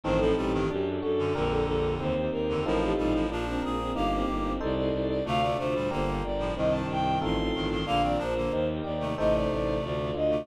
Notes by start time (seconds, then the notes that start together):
0.03 A1 G2 D#3 C4 D#4 A4 C5
0.18 A2 F3 A4
0.36 A1 A#2 G3 G4
0.53 G2 D#3
0.70 F#2 D4 F#4 G4 A4
1.01 F#2 F#4 A4
1.18 F#2 D3
1.35 A#1 F2 D3 D4 G4 A#4
1.49 A4
1.65 A#1 A4
2.00 D#2 C4 D#4 G4 C5
2.32 D#2 D#4 A#4
2.49 F2 D3
2.65 A1 A2 F3 C4 D#4 F4 A4 A#4
2.82 G4
2.98 A1 A#2 G3 D#4
3.14 A2 F3
3.29 A#1 F3 D4 F4 A#4
3.47 C4
3.62 A#1 G#4 A#4
3.79 C4
3.95 G1 A#3 D#4 G4 A#4 F5
4.13 C4
4.28 G1 G4
4.44 C4
4.60 C2 D#4 A4 C5 D5
4.75 D5
4.93 C2
5.08 D5
5.25 D2 C3 A3 D4 F4 A4 F5
5.42 C3 A3 D5
5.58 D2 C3 A3 F4 C5
5.75 A#2 G3
5.91 G1 D3 A#3 D4 G4 A#4 C5
6.23 G1 D5
6.39 A2 F3
6.56 C2 G2 D#3 C4 D#4 G4 D#5
6.71 A5
6.89 C2 D#4 G5
7.21 A1 C4 D#4 F4 A4 C6
7.54 A1 G2 D#3
7.70 G2 D#3
7.86 A#1 D3 A#3 D4 F4 A#4 F5
8.02 D#3 C4 D5
8.18 A#1 F3 D4 A#4 C5
8.37 D3 A#3
8.51 D#2 D#4 G4 A#4 C5
8.84 D#2 G4 D5
9.00 C3 A3
9.18 A1 C3 A3 D#4 A4 C5 D#5
9.34 D5
9.50 A1 D5
9.82 D2 D4 F4 A4 D5
10.14 D2 F4 D#5
10.30 C3 A3